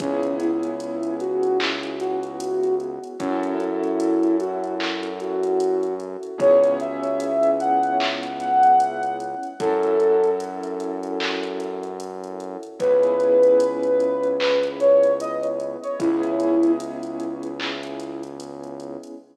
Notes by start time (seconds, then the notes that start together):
0.00 C#2 B3 C#4 E4 G#4, kick, closed hi-hat
0.23 closed hi-hat
0.40 E4, closed hi-hat
0.63 closed hi-hat
0.80 closed hi-hat
1.03 closed hi-hat
1.20 F#4, closed hi-hat
1.43 closed hi-hat
1.60 clap
1.83 closed hi-hat
2.00 F#4, closed hi-hat
2.23 closed hi-hat
2.40 closed hi-hat
2.64 closed hi-hat
2.80 closed hi-hat
3.04 closed hi-hat
3.20 F#2 C#4 E4 F#4 A4, kick, closed hi-hat
3.43 closed hi-hat
3.60 E4, closed hi-hat
3.84 closed hi-hat
4.00 closed hi-hat
4.23 closed hi-hat
4.40 F#4, closed hi-hat
4.64 closed hi-hat
4.80 clap
5.03 closed hi-hat
5.20 F#4, closed hi-hat
5.43 closed hi-hat
5.60 closed hi-hat
5.83 closed hi-hat
6.00 closed hi-hat
6.23 closed hi-hat
6.38 C#2 B3 C#4 E4 G#4 C#5, kick, closed hi-hat
6.64 closed hi-hat
6.80 E5, closed hi-hat
7.04 closed hi-hat
7.20 closed hi-hat
7.43 closed hi-hat
7.60 F#5, closed hi-hat
7.83 closed hi-hat
8.00 clap
8.23 closed hi-hat
8.40 F#5, closed hi-hat
8.63 closed hi-hat
8.80 closed hi-hat
9.03 closed hi-hat
9.20 closed hi-hat
9.43 closed hi-hat
9.60 F#2 C#4 E4 F#4 A4, kick, closed hi-hat
9.83 closed hi-hat
10.00 closed hi-hat
10.24 closed hi-hat
10.40 closed hi-hat
10.63 closed hi-hat
10.80 closed hi-hat
11.03 closed hi-hat
11.20 clap
11.43 closed hi-hat
11.60 closed hi-hat
11.83 closed hi-hat
12.00 closed hi-hat
12.24 closed hi-hat
12.40 closed hi-hat
12.63 closed hi-hat
12.80 C#2 B3 C#4 E4 G#4 B4, kick, closed hi-hat
13.03 closed hi-hat
13.20 closed hi-hat
13.43 closed hi-hat
13.60 closed hi-hat
13.83 closed hi-hat
14.00 closed hi-hat
14.24 closed hi-hat
14.40 B4, clap
14.63 closed hi-hat
14.80 C#5, closed hi-hat
15.04 closed hi-hat
15.20 D#5, closed hi-hat
15.43 closed hi-hat
15.60 closed hi-hat
15.83 C#5, closed hi-hat
16.00 C#2 B3 C#4 E4 G#4, kick, closed hi-hat
16.23 closed hi-hat
16.40 closed hi-hat
16.63 closed hi-hat
16.80 closed hi-hat
17.03 closed hi-hat
17.20 closed hi-hat
17.43 closed hi-hat
17.60 clap
17.83 closed hi-hat
18.00 closed hi-hat
18.23 closed hi-hat
18.40 closed hi-hat
18.64 closed hi-hat
18.80 closed hi-hat
19.04 closed hi-hat